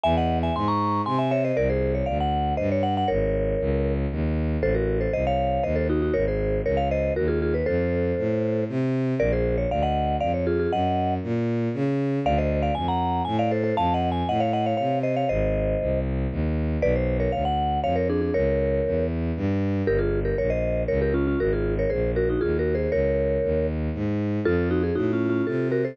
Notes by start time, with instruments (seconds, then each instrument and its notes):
0.03 violin E2, vibraphone E5 G#5
0.17 vibraphone D#5 F#5
0.43 vibraphone E5 G#5
0.55 violin G#2, vibraphone G#5 C6
0.68 vibraphone A#5 C#6
1.06 violin C3, vibraphone G#5 C6
1.19 vibraphone E5 G#5
1.31 vibraphone C#5 E5
1.44 vibraphone C5 D#5
1.57 violin C2, vibraphone A#4 D5
1.70 vibraphone G#4 C5
1.95 vibraphone C#5
2.06 violin D2, vibraphone D5 F5
2.20 vibraphone F#5
2.57 violin G2, vibraphone C5 D#5
2.72 vibraphone C#5
2.83 vibraphone F#5
2.97 vibraphone F#5
3.08 violin G#1, vibraphone A#4 C#5
3.60 violin C#2
4.11 violin D#2
4.62 violin A1, vibraphone A4 C5
4.74 vibraphone F#4 A#4
5.01 vibraphone A4 C5
5.13 violin C2, vibraphone C5 D#5
5.27 vibraphone C#5 F5
5.63 violin D#2, vibraphone C5 D#5
5.76 vibraphone A4 C5
5.89 vibraphone D#4 F#4
6.02 vibraphone D#4 F#4
6.14 violin G#1, vibraphone A#4 C#5
6.28 vibraphone G#4 C5
6.65 violin C#2, vibraphone A#4 C#5
6.77 vibraphone C#5 F5
6.91 vibraphone C5 D#5
7.16 violin D#2, vibraphone F#4 A#4
7.28 vibraphone F4 G#4
7.42 vibraphone F4 G#4
7.54 vibraphone B4
7.66 violin F2, vibraphone A4 C5
8.18 violin A2
8.69 violin C3
9.19 violin A#1, vibraphone A#4 D5
9.32 vibraphone G#4 C5
9.58 vibraphone C#5
9.70 violin D2, vibraphone D5 F5
9.83 vibraphone D#5 F#5
10.20 violin F2, vibraphone D5 F5
10.34 vibraphone C#5
10.47 vibraphone F4 G#4
10.59 vibraphone F4 G#4
10.72 violin F#2, vibraphone D#5 F#5
11.23 violin A#2
11.74 violin C#3
12.25 violin D2, vibraphone D5 F5
12.38 vibraphone C5 D#5
12.62 vibraphone D5 F5
12.75 violin F2, vibraphone G#5
12.88 vibraphone F#5 A#5
13.25 violin A2, vibraphone G#5
13.39 vibraphone D5 F5
13.51 vibraphone A4 C5
13.64 vibraphone A4 C5
13.77 violin F2, vibraphone F5 A5
13.94 vibraphone D#5 F#5
14.12 vibraphone G#5
14.28 violin A2, vibraphone D#5 F#5
14.40 vibraphone C#5 F5
14.53 vibraphone D#5 F#5
14.66 vibraphone C#5 F5
14.77 violin C3, vibraphone C#5 F5
15.03 vibraphone C5 D#5
15.16 vibraphone C#5 F5
15.29 violin G#1, vibraphone C5 D#5
15.81 violin C2
16.31 violin D#2
16.82 violin B1, vibraphone B4 D5
16.96 vibraphone C5
17.20 vibraphone A#4 C#5
17.32 violin D2, vibraphone C#5 F5
17.45 vibraphone F#5
17.84 violin F2, vibraphone C#5 F5
17.96 vibraphone A#4 C#5
18.09 vibraphone D4 G#4
18.21 vibraphone D4 G#4
18.34 violin C#2, vibraphone A#4 C#5
18.85 violin E2
19.36 violin G2
19.87 violin G1, vibraphone G4 A#4
19.99 vibraphone F4 G#4
20.25 vibraphone G4 A#4
20.38 violin A#1, vibraphone A#4 C#5
20.50 vibraphone C5 D#5
20.88 violin C#2, vibraphone A#4 C#5
21.02 vibraphone G4 A#4
21.14 vibraphone C#4 F4
21.27 vibraphone C#4 F4
21.40 violin G#1, vibraphone F#4 A#4
21.53 vibraphone F4 G#4
21.79 vibraphone A#4 C#5
21.90 violin A#1, vibraphone G#4 C5
22.16 vibraphone F#4 A#4
22.29 vibraphone D#4 F#4
22.41 violin D#2, vibraphone F4 G#4
22.59 vibraphone F#4 A#4
22.75 vibraphone G#4 C5
22.92 violin C#2, vibraphone A#4 C#5
23.43 violin D#2
23.94 violin G#2
24.45 violin F2, vibraphone F4 A4
24.71 vibraphone D#4 F#4
24.83 vibraphone G#4
24.95 violin A2, vibraphone D#4 F#4
25.13 vibraphone C#4 F4
25.30 vibraphone C#4 F4
25.47 violin C3, vibraphone F4 A4
25.72 vibraphone F#4 A#4
25.85 vibraphone A4 C5